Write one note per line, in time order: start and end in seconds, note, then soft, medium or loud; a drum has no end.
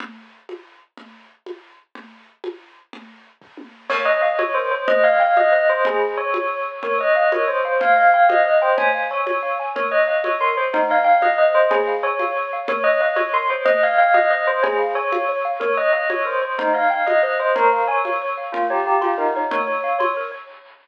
0.00 low conga loud
0.49 high conga medium
0.97 low conga medium
1.46 high conga medium
1.95 low conga loud
2.44 high conga loud
2.93 low conga loud
3.42 kick medium
3.57 high tom medium
3.89 4.06 A#4 medium
3.89 4.04 C#5 loud
3.89 crash loud
3.89 low conga loud
4.05 4.20 C#5 medium
4.05 4.18 D#5 loud
4.21 4.36 D#5 loud
4.21 4.37 F5 medium
4.39 4.53 C#5 medium
4.39 4.54 C#5 medium
4.39 high conga loud
4.54 4.71 A#4 medium
4.54 4.70 C5 medium
4.71 4.85 C5 medium
4.71 4.86 C#5 medium
4.88 5.02 C5 medium
4.88 5.01 D#5 loud
4.88 low conga loud
5.04 5.19 D#5 medium
5.04 5.18 F5 medium
5.20 5.37 F5 loud
5.20 5.34 G5 medium
5.37 5.51 D#5 medium
5.37 5.52 D#5 loud
5.37 high conga medium
5.52 5.66 C5 medium
5.52 5.67 D#5 medium
5.69 5.85 C5 loud
5.69 5.84 D#5 medium
5.85 6.00 G#4 loud
5.85 low conga loud
6.17 6.60 C#5 loud
6.34 high conga loud
6.83 6.99 A#4 medium
6.83 6.98 C#5 loud
6.83 low conga loud
6.98 7.13 C#5 medium
6.98 7.14 D#5 loud
7.15 7.30 D#5 loud
7.15 7.31 F5 medium
7.32 7.47 A#4 medium
7.32 7.46 C#5 medium
7.32 high conga loud
7.47 7.63 C5 medium
7.47 7.62 C#5 medium
7.65 7.78 C5 medium
7.65 7.80 F5 medium
7.80 7.95 C5 medium
7.80 7.95 F5 loud
7.80 low conga loud
7.96 8.10 D#5 medium
7.96 8.11 F5 medium
8.14 8.29 F5 loud
8.14 8.28 G5 medium
8.29 8.44 C5 medium
8.29 8.44 D#5 loud
8.29 high conga loud
8.45 8.59 D#5 medium
8.45 8.60 D#5 medium
8.62 8.78 C5 loud
8.62 8.76 G5 medium
8.77 8.92 C#5 medium
8.77 8.91 G#5 loud
8.77 low conga loud
8.94 9.09 F5 medium
9.11 9.53 C#5 loud
9.11 9.25 G#5 medium
9.26 9.41 C#5 medium
9.26 high conga medium
9.43 9.57 F5 medium
9.60 9.74 G#5 medium
9.76 9.90 A#4 medium
9.76 9.90 C#5 loud
9.76 low conga loud
9.91 10.06 C#5 medium
9.91 10.05 D#5 loud
10.07 10.22 D#5 loud
10.07 10.22 F5 medium
10.24 10.39 C#5 medium
10.24 high conga medium
10.41 10.55 A#4 medium
10.41 10.56 C6 medium
10.57 10.70 C5 medium
10.57 10.72 C#5 medium
10.73 10.87 D#4 loud
10.73 10.88 C5 medium
10.73 low conga loud
10.90 11.05 D#5 medium
10.90 11.04 F5 medium
11.04 11.20 F5 loud
11.04 11.19 G5 medium
11.21 11.36 D#5 medium
11.21 11.37 D#5 loud
11.21 high conga medium
11.38 11.54 C5 medium
11.38 11.52 D#5 medium
11.54 11.71 C5 loud
11.54 11.69 D#5 medium
11.71 11.84 G#4 loud
11.71 11.87 C#5 medium
11.71 low conga loud
11.87 12.02 F5 medium
12.03 12.45 C#5 loud
12.03 12.18 G#5 medium
12.19 12.34 F5 medium
12.19 high conga medium
12.37 12.51 C#5 medium
12.53 12.68 F5 medium
12.68 12.83 A#4 medium
12.68 12.83 C#5 loud
12.68 low conga loud
12.84 13.00 C#5 medium
12.84 12.97 D#5 loud
13.00 13.16 D#5 loud
13.00 13.15 F5 medium
13.16 13.30 C#5 medium
13.16 13.32 C#5 medium
13.16 high conga medium
13.33 13.48 A#4 medium
13.33 13.49 C6 medium
13.50 13.63 C5 medium
13.50 13.65 C#5 medium
13.65 13.80 C5 medium
13.65 13.79 D#5 loud
13.65 low conga loud
13.83 13.98 D#5 medium
13.83 13.97 F5 medium
13.98 14.14 F5 loud
13.98 14.14 G5 medium
14.14 14.29 D#5 loud
14.14 14.30 D#5 medium
14.14 high conga medium
14.30 14.46 C5 medium
14.30 14.44 D#5 medium
14.47 14.63 C5 loud
14.47 14.61 D#5 medium
14.63 14.77 G#4 loud
14.63 14.77 C#5 medium
14.63 low conga loud
14.79 14.93 F5 medium
14.95 15.37 C#5 loud
14.95 15.11 G#5 medium
15.12 15.27 F5 medium
15.12 high conga loud
15.29 15.43 C#5 medium
15.45 15.59 F5 medium
15.60 15.75 A#4 medium
15.60 15.76 C#5 loud
15.60 low conga loud
15.77 15.93 C#5 medium
15.77 15.91 D#5 loud
15.93 16.08 D#5 loud
15.93 16.08 F5 medium
16.10 16.24 C#5 medium
16.10 16.25 C#5 medium
16.10 high conga loud
16.25 16.40 A#4 medium
16.25 16.41 C5 medium
16.42 16.55 C5 medium
16.42 16.57 C#5 medium
16.58 16.72 D#4 loud
16.58 16.74 C5 medium
16.58 low conga loud
16.74 16.88 D#5 medium
16.74 16.89 F5 medium
16.90 17.07 F5 loud
16.90 17.05 G5 medium
17.06 17.21 D#5 loud
17.06 17.22 D#5 medium
17.06 high conga medium
17.23 17.38 C5 medium
17.23 17.37 D#5 medium
17.39 17.55 C5 loud
17.39 17.55 D#5 medium
17.55 17.69 A#4 loud
17.55 17.71 C#5 medium
17.55 low conga loud
17.72 17.87 F5 medium
17.87 18.30 C#5 loud
17.87 18.03 G#5 medium
18.05 18.20 F5 medium
18.05 high conga medium
18.22 18.36 C#5 medium
18.37 18.52 F5 medium
18.52 18.66 F4 loud
18.52 18.68 A#4 medium
18.52 low conga loud
18.70 18.85 G4 medium
18.70 18.85 C#5 medium
18.86 19.00 G4 medium
18.86 19.00 F5 medium
19.01 19.19 F4 medium
19.01 19.16 C6 medium
19.01 high conga medium
19.17 19.33 D#4 loud
19.17 19.32 A#4 medium
19.35 19.49 D#4 medium
19.35 19.51 C#5 medium
19.51 19.66 A#4 medium
19.51 19.98 C#5 loud
19.51 low conga loud
19.67 19.82 C#5 medium
19.84 19.98 F5 medium
19.99 20.12 C#5 medium
19.99 20.14 C6 medium
19.99 high conga medium
20.17 20.31 A#4 medium
20.32 20.46 C#5 medium